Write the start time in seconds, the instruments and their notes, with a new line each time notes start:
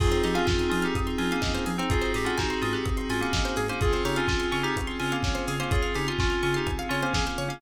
0.00 synth bass 2 F2, electric piano 2 C4 D#4 F4 G#4, pad 5 (bowed) C4 D#4 F4 G#4, pizzicato strings G#4, kick, crash
0.12 pizzicato strings C5, closed hi-hat
0.23 synth bass 2 F3, electric piano 2 D#4 G4, pizzicato strings D#5, open hi-hat
0.34 electric piano 2 C#4 F4, pizzicato strings F5, closed hi-hat
0.46 synth bass 2 F2, electric piano 2 C#4 F4, pizzicato strings G#5, kick, snare
0.59 pizzicato strings C6, closed hi-hat
0.69 synth bass 2 F3, electric piano 2 C#4 F4, pizzicato strings D#6, open hi-hat
0.82 electric piano 2 D#4 G4, pizzicato strings F6, closed hi-hat
0.95 synth bass 2 F2, pizzicato strings D#6, kick, closed hi-hat
1.07 pizzicato strings C6, closed hi-hat
1.18 synth bass 2 F3, electric piano 2 C#4 F4, pizzicato strings G#5, open hi-hat
1.31 electric piano 2 A#3 C#4, pizzicato strings F5, closed hi-hat
1.42 synth bass 2 F2, pizzicato strings D#5, kick, snare
1.54 pizzicato strings C5, closed hi-hat
1.66 synth bass 2 F3, pizzicato strings G#4, open hi-hat
1.78 electric piano 2 C4 D#4, pizzicato strings C5, closed hi-hat
1.90 synth bass 2 G#1, electric piano 2 C4 D#4 F4 F#4 G#4, pad 5 (bowed) C4 D#4 F#4 G#4, pizzicato strings G#4, kick, closed hi-hat
2.01 pizzicato strings C5, closed hi-hat
2.14 synth bass 2 G#2, electric piano 2 G4, pizzicato strings D#5, open hi-hat
2.25 electric piano 2 C#4 F4, pizzicato strings F#5, closed hi-hat
2.38 synth bass 2 G#1, electric piano 2 D#4 F#4, pizzicato strings G#5, kick, snare
2.50 pizzicato strings C6, closed hi-hat
2.61 synth bass 2 G#2, electric piano 2 C#4 F4, pizzicato strings D#6, open hi-hat
2.73 electric piano 2 G4, pizzicato strings F#6, closed hi-hat
2.86 synth bass 2 G#1, pizzicato strings D#6, kick, closed hi-hat
2.97 pizzicato strings C6, closed hi-hat
3.10 synth bass 2 G#2, electric piano 2 C#4 F4, pizzicato strings G#5, open hi-hat
3.21 electric piano 2 A#3 C#4, pizzicato strings F#5, closed hi-hat
3.33 synth bass 2 G#1, pizzicato strings D#5, kick, snare
3.45 pizzicato strings C5, closed hi-hat
3.56 synth bass 2 G#2, pizzicato strings G#4, open hi-hat
3.68 electric piano 2 A#3 C#4, pizzicato strings C5, closed hi-hat
3.81 synth bass 2 C#2, pad 5 (bowed) C4 C#4 F4 G#4, electric piano 2 C4 C#4 F4 G#4, pizzicato strings G#4, kick, closed hi-hat
3.93 pizzicato strings C5, closed hi-hat
4.05 synth bass 2 C#3, electric piano 2 D#4 G4, pizzicato strings C#5, open hi-hat
4.16 electric piano 2 C#4 F4, pizzicato strings F5, closed hi-hat
4.28 synth bass 2 C#2, electric piano 2 C#4 F4, pizzicato strings G#5, kick, snare
4.40 pizzicato strings C6, closed hi-hat
4.51 synth bass 2 C#3, electric piano 2 C#4 F4, pizzicato strings C#6, open hi-hat
4.63 electric piano 2 D#4 G4, pizzicato strings F6, closed hi-hat
4.76 synth bass 2 C#2, pizzicato strings C#6, kick, closed hi-hat
4.87 pizzicato strings C6, closed hi-hat
5.00 synth bass 2 C#3, electric piano 2 C#4 F4, pizzicato strings G#5, open hi-hat
5.12 electric piano 2 A#3 C#4, pizzicato strings F5, closed hi-hat
5.23 synth bass 2 C#2, pizzicato strings C#5, kick, snare
5.35 pizzicato strings C5, closed hi-hat
5.48 synth bass 2 C#3, pizzicato strings G#4, open hi-hat
5.60 electric piano 2 A#3 C#4, pizzicato strings C5, closed hi-hat
5.71 synth bass 2 C#2, electric piano 2 F4 G#4, pizzicato strings C#5, kick, closed hi-hat
5.82 pizzicato strings F5, closed hi-hat
5.95 synth bass 2 C#3, electric piano 2 D#4 G4, pizzicato strings G#5, open hi-hat
6.07 electric piano 2 C#4 F4, pizzicato strings C6, closed hi-hat
6.19 synth bass 2 C#2, electric piano 2 C#4 F4, pizzicato strings C#6, kick, snare
6.30 pizzicato strings F6, closed hi-hat
6.43 synth bass 2 C#3, electric piano 2 C#4 F4, pizzicato strings C#6, open hi-hat
6.54 electric piano 2 D#4 G4, pizzicato strings C6, closed hi-hat
6.66 synth bass 2 C#2, pizzicato strings G#5, kick, closed hi-hat
6.79 pizzicato strings F5, closed hi-hat
6.89 synth bass 2 C#3, electric piano 2 C#4 F4, pizzicato strings C#5, open hi-hat
7.02 electric piano 2 A#3 C#4, pizzicato strings C5, closed hi-hat
7.14 synth bass 2 C#2, pizzicato strings G#4, kick, snare
7.26 pizzicato strings C5, closed hi-hat
7.38 synth bass 2 C#3, pizzicato strings C#5, open hi-hat
7.48 electric piano 2 A#3 C#4, pizzicato strings F5, closed hi-hat